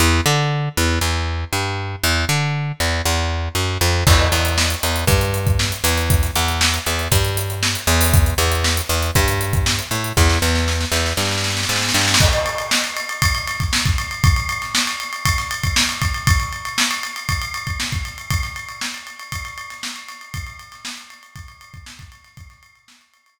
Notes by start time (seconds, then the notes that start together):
0.00 E2
0.26 D3
0.77 E2
1.01 E2
1.53 G2
2.03 E2
2.29 D3
2.80 E2
3.06 E2
3.55 F#2
3.81 F2
4.07 E2, kick, crash
4.19 snare
4.32 E2, closed hi-hat
4.45 closed hi-hat
4.58 snare
4.70 closed hi-hat
4.83 E2, closed hi-hat
4.96 closed hi-hat
5.07 G2, kick, closed hi-hat
5.21 closed hi-hat
5.34 closed hi-hat
5.47 kick, closed hi-hat
5.59 snare
5.72 closed hi-hat
5.84 E2, closed hi-hat
5.98 closed hi-hat
6.10 kick, closed hi-hat
6.23 snare, closed hi-hat
6.35 E2, closed hi-hat
6.48 closed hi-hat
6.61 snare
6.74 closed hi-hat
6.86 E2, closed hi-hat
6.99 closed hi-hat
7.12 G2, kick, closed hi-hat
7.25 closed hi-hat
7.37 closed hi-hat
7.50 closed hi-hat
7.63 snare
7.75 closed hi-hat
7.87 E2, closed hi-hat
8.01 snare, open hi-hat
8.14 kick, closed hi-hat
8.26 closed hi-hat
8.38 E2, snare, closed hi-hat
8.52 closed hi-hat
8.64 snare
8.77 closed hi-hat
8.89 E2, closed hi-hat
9.03 closed hi-hat
9.15 G2, kick, closed hi-hat
9.28 closed hi-hat
9.41 closed hi-hat
9.53 kick, closed hi-hat
9.66 snare
9.79 closed hi-hat
9.91 A2, closed hi-hat
10.04 closed hi-hat
10.17 E2, kick, snare
10.30 snare
10.42 E2, snare
10.55 snare
10.68 snare
10.81 snare
10.92 E2, snare
11.06 snare
11.17 G2, snare
11.25 snare
11.31 snare
11.38 snare
11.44 snare
11.50 snare
11.57 snare
11.63 snare
11.69 G#2, snare
11.76 snare
11.82 snare
11.89 snare
11.94 G2, snare
12.01 snare
12.08 snare
12.14 snare
12.20 kick, crash
12.33 snare, ride
12.46 ride
12.58 ride
12.71 snare
12.84 ride
12.97 ride
13.09 ride
13.22 kick, ride
13.35 ride
13.47 snare, ride
13.60 kick, ride
13.73 snare
13.85 kick, ride
13.98 ride
14.11 ride
14.24 kick, ride
14.36 ride
14.49 ride
14.62 snare, ride
14.75 snare
14.87 snare, ride
15.00 ride
15.13 ride
15.25 kick, ride
15.38 snare, ride
15.51 ride
15.64 kick, ride
15.76 snare
15.89 snare, ride
16.02 kick, ride
16.14 ride
16.27 kick, ride
16.40 ride
16.53 ride
16.65 ride
16.78 snare
16.91 ride
17.03 ride
17.16 ride
17.29 kick, ride
17.42 ride
17.54 ride
17.67 kick, ride
17.80 snare
17.92 kick, ride
18.05 ride
18.18 ride
18.31 kick, ride
18.43 snare, ride
18.56 ride
18.69 ride
18.81 snare
18.94 ride
19.07 ride
19.19 ride
19.32 kick, ride
19.45 ride
19.58 ride
19.70 snare, ride
19.83 snare
19.96 ride
20.08 snare, ride
20.21 ride
20.34 kick, ride
20.47 ride
20.59 ride
20.72 snare, ride
20.85 snare
20.98 snare, ride
21.10 ride
21.23 ride
21.36 kick, ride
21.48 ride
21.61 ride
21.74 kick, ride
21.86 snare
21.99 kick, ride
22.12 ride
22.24 snare, ride
22.37 kick, ride
22.50 snare, ride
22.63 ride
22.76 ride
22.88 snare
23.01 ride
23.14 ride
23.26 ride